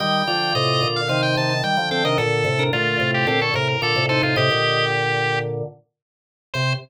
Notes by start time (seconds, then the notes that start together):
0.00 D#3 G3 G4 D#5 G5
0.27 D3 F3 F4 D5
0.55 A2 C3 D#5
0.83 A#2 D3
0.96 F5
1.08 C3 D#3 D#4 C5 F5
1.23 G5
1.36 C3 D#3 A5
1.50 A5
1.63 D#3 G3 G5
1.77 D3 F3
1.91 C4 A4 G5
2.05 C3 D#3 D4 A#4 D#5
2.18 A#2 D3 A4
2.45 A2 C3
2.59 D4 A#4
2.73 A#2 D3 A3 F4
3.00 A2 C3
3.14 G4
3.27 A#2 D3 C4 G4 A4
3.41 A4 C#5
3.54 A2 C3 A#4
3.68 A#4
3.82 A#2 D3 F4 A4 D5
3.96 A2 C3
4.09 D#4 A4 C5
4.23 A2 C3 F4
4.36 A2 C3 G4 D#5
4.51 A#2 D3
6.54 C3 C5